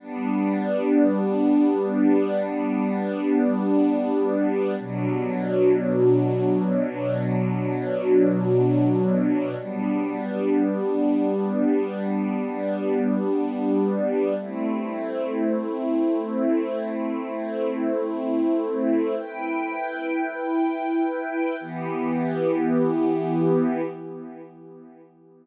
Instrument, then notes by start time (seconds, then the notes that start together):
string ensemble 1
0.00 G3 B3 D4
4.79 B2 F#3 D4
9.59 G3 B3 D4
14.40 A3 C4 E4
19.18 E4 B4 G5
21.61 E3 B3 G4